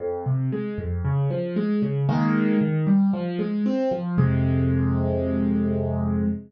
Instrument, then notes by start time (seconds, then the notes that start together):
acoustic grand piano
0.00 F2
0.26 C3
0.52 G#3
0.78 F2
1.05 C#3
1.30 F3
1.56 G#3
1.82 C#3
2.09 D#3 G#3 A#3
2.61 D#3
2.87 G3
3.13 F3
3.39 G#3
3.66 C4
3.91 F3
4.18 F2 C3 G#3